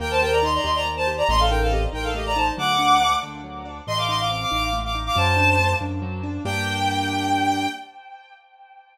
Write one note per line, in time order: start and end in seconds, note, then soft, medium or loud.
0.00 0.59 D#2 loud
0.00 0.19 A#3 medium
0.00 0.10 A#4 medium
0.00 0.10 G5 medium
0.11 0.21 C5 medium
0.11 0.21 A5 medium
0.21 0.41 G4 medium
0.21 0.32 A#4 medium
0.21 0.32 G5 medium
0.32 0.43 D5 medium
0.32 0.43 A#5 medium
0.43 0.62 D#4 medium
0.43 0.54 D#5 medium
0.43 0.54 C6 medium
0.55 0.65 D5 medium
0.55 0.65 A#5 medium
0.64 1.23 D#2 medium
0.64 0.83 G4 medium
0.64 0.75 D#5 medium
0.64 0.75 C6 medium
0.75 0.85 D5 medium
0.75 0.85 A#5 medium
0.85 1.04 A#3 medium
0.97 1.07 C5 medium
0.97 1.07 A5 medium
1.07 1.27 G4 medium
1.17 1.28 D5 medium
1.17 1.28 A#5 medium
1.29 1.87 A1 loud
1.29 1.49 A3 loud
1.29 1.39 D#5 medium
1.29 1.39 C6 loud
1.40 1.50 A4 medium
1.40 1.50 F5 medium
1.50 1.70 D#4 medium
1.50 1.60 A#4 medium
1.50 1.60 G5 medium
1.61 1.72 A4 medium
1.61 1.72 F5 medium
1.71 1.91 C4 medium
1.71 1.81 G4 medium
1.71 1.81 D#5 medium
1.93 2.51 A1 medium
1.93 2.12 D#4 medium
1.93 2.04 A#4 medium
1.93 2.04 G5 medium
2.03 2.14 A4 medium
2.03 2.14 F5 medium
2.15 2.34 A3 medium
2.15 2.25 G4 medium
2.15 2.25 D#5 medium
2.26 2.36 D5 medium
2.26 2.36 A#5 medium
2.36 2.55 D#4 medium
2.36 2.47 C5 medium
2.36 2.47 A5 medium
2.57 3.16 D2 loud
2.57 2.77 F#3 medium
2.57 3.13 F#5 medium
2.57 3.13 D6 medium
2.79 2.98 D4 medium
3.01 3.21 A3 medium
3.22 3.81 D2 medium
3.22 3.41 D4 medium
3.44 3.63 F#3 medium
3.65 3.85 D4 medium
3.87 4.45 A1 loud
3.87 4.07 A3 medium
3.87 3.97 D#5 medium
3.87 3.97 C6 loud
3.98 4.08 F5 medium
3.98 4.08 D6 medium
4.08 4.28 D#4 medium
4.08 4.19 D#5 medium
4.08 4.19 C6 medium
4.20 4.30 F5 medium
4.20 4.30 D6 medium
4.31 4.50 C4 medium
4.31 4.41 F5 medium
4.31 4.41 D6 medium
4.41 4.51 F5 medium
4.41 4.51 D6 medium
4.51 5.10 A1 medium
4.51 4.70 D#4 medium
4.51 4.62 F5 medium
4.51 4.62 D6 medium
4.63 4.74 F5 medium
4.63 4.74 D6 medium
4.73 4.92 A3 medium
4.84 4.95 F5 medium
4.84 4.95 D6 medium
4.95 5.14 D#4 medium
5.06 5.16 F5 medium
5.06 5.16 D6 medium
5.15 5.74 F#2 loud
5.15 5.35 F#3 medium
5.15 5.71 C5 medium
5.15 5.71 A5 loud
5.37 5.56 D4 medium
5.59 5.79 A3 medium
5.81 6.39 F#2 medium
5.81 6.00 D4 medium
6.02 6.21 F#3 medium
6.23 6.43 D4 medium
6.45 7.67 G2 loud
6.45 7.67 A#3 loud
6.45 7.67 D4 loud
6.45 7.67 G4 loud
6.45 7.67 G5 loud